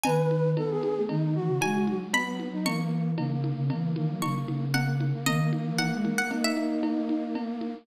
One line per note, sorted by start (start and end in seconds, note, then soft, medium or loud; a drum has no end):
0.03 0.55 D#3 loud
0.03 0.50 B4 medium
0.03 0.77 G#5 medium
0.03 cowbell medium
0.03 low conga medium
0.31 high conga medium
0.56 0.92 B3 medium
0.56 0.69 A4 medium
0.56 cowbell medium
0.56 high conga medium
0.70 1.02 G#4 medium
0.83 high conga medium
0.97 1.09 A3 medium
1.09 1.35 D#3 medium
1.09 1.34 D#4 medium
1.09 cowbell medium
1.09 low conga medium
1.35 1.47 E3 medium
1.35 1.97 F#4 medium
1.48 1.60 C#3 medium
1.61 1.85 G#3 medium
1.61 2.09 G#5 medium
1.61 cowbell medium
1.61 high conga medium
1.87 2.53 F#3 medium
1.87 high conga medium
2.13 2.48 B3 medium
2.13 2.36 B5 medium
2.13 cowbell medium
2.13 low conga medium
2.39 high conga medium
2.53 2.65 D#4 medium
2.65 3.15 E3 medium
2.65 3.11 A#3 medium
2.65 3.34 C#6 medium
2.65 cowbell medium
2.65 low conga medium
3.18 3.52 C#3 medium
3.18 3.30 A#3 medium
3.18 cowbell medium
3.18 high conga medium
3.31 3.65 A#3 medium
3.44 high conga medium
3.58 3.70 C#3 loud
3.70 3.95 E3 medium
3.70 3.91 A#3 medium
3.70 cowbell medium
3.70 low conga medium
3.96 4.08 D#3 medium
3.96 4.65 A#3 medium
3.96 high conga medium
4.09 4.21 F#3 medium
4.22 4.44 C#3 medium
4.22 4.65 C#6 medium
4.22 cowbell medium
4.22 high conga medium
4.48 5.12 C#3 medium
4.48 high conga medium
4.74 5.05 A#3 medium
4.74 4.95 F#5 medium
4.74 cowbell medium
4.74 low conga medium
5.00 high conga medium
5.13 5.25 A#3 medium
5.26 5.51 D#3 loud
5.26 7.75 A#3 loud
5.26 5.51 D#5 medium
5.26 cowbell medium
5.26 low conga medium
5.53 high conga medium
5.66 5.78 E3 medium
5.78 5.92 E3 medium
5.78 6.10 F#5 medium
5.78 cowbell medium
5.78 high conga medium
5.93 6.05 G#3 medium
6.05 6.29 A#3 medium
6.05 high conga medium
6.18 6.31 F#5 medium
6.31 7.22 D#4 medium
6.31 cowbell medium
6.31 low conga medium
6.44 7.00 E5 medium
6.57 high conga medium
6.83 cowbell medium
6.83 high conga medium
7.09 high conga medium
7.35 cowbell medium
7.35 low conga medium
7.61 high conga medium